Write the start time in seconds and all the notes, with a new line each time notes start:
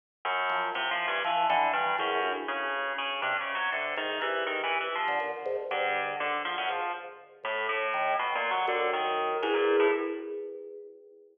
0.25 F#2
0.49 F3
0.75 C3 E3
0.91 F3
1.07 G2
1.24 E3 F3
1.49 D3 E3
1.73 G2
1.98 E2 F#2
2.22 D2
2.48 C#3
2.98 C#3
3.22 G2 C3
3.40 C#3
3.54 F#3
3.72 C3 D3
3.96 G#2 D#3
4.21 G2 E3
4.46 D#3
4.63 E3
4.80 E3
4.95 F3
5.08 D3
5.20 A#2
5.45 G#2
5.70 G2 D3
6.20 D3
6.45 F3
6.58 F#2
6.69 G#2 F3
7.43 A2
7.69 A2
7.93 D#3
8.19 B2
8.35 A#2
8.50 F#3
8.67 F#2 D3
8.93 D#3
9.42 E2 G#2
9.54 A#2
9.80 A2